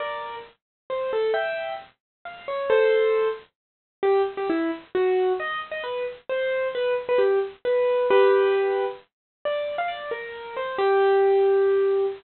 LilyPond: \new Staff { \time 6/8 \key g \minor \tempo 4. = 89 <bes' d''>4 r4 c''8 a'8 | <e'' g''>4 r4 f''8 cis''8 | <a' c''>4. r4. | \key g \major g'8 r16 g'16 e'8 r8 fis'4 |
dis''8 r16 dis''16 b'8 r8 c''4 | b'8 r16 b'16 g'8 r8 b'4 | <g' b'>2 r4 | \key g \minor d''8. f''16 d''8 bes'4 c''8 |
g'2. | }